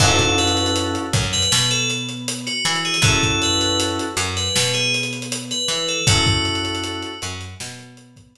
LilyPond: <<
  \new Staff \with { instrumentName = "Tubular Bells" } { \time 4/4 \key fis \minor \tempo 4 = 79 a'8 b'8 r8. b'8 a'16 r8. fis'8 gis'16 | a'8 b'8 r8. b'8 gis'16 r8. b'8 a'16 | fis'4. r2 r8 | }
  \new Staff \with { instrumentName = "Electric Piano 2" } { \time 4/4 \key fis \minor <cis' e' fis' a'>4. fis8 b4. e'8 | <cis' e' fis' a'>4. fis8 b4. e'8 | <cis' e' fis' a'>4. fis8 b4. r8 | }
  \new Staff \with { instrumentName = "Electric Bass (finger)" } { \clef bass \time 4/4 \key fis \minor fis,4. fis,8 b,4. e8 | fis,4. fis,8 b,4. e8 | fis,4. fis,8 b,4. r8 | }
  \new DrumStaff \with { instrumentName = "Drums" } \drummode { \time 4/4 <cymc bd>16 <hh bd>16 hh32 hh32 hh32 hh32 hh16 hh16 <hh bd>32 hh32 hh32 hh32 sn16 hh16 hh16 hh16 hh16 hh16 hh32 hh32 hh32 hh32 | <hh bd>16 <hh bd>16 hh16 hh16 hh16 hh16 hh16 hh16 sn16 hh16 hh32 hh32 hh32 hh32 hh16 hh16 hh16 hh16 | <hh bd>16 <hh bd>16 hh32 hh32 hh32 hh32 hh16 hh16 hh16 hh16 sn16 hh16 hh16 <hh bd>16 hh4 | }
>>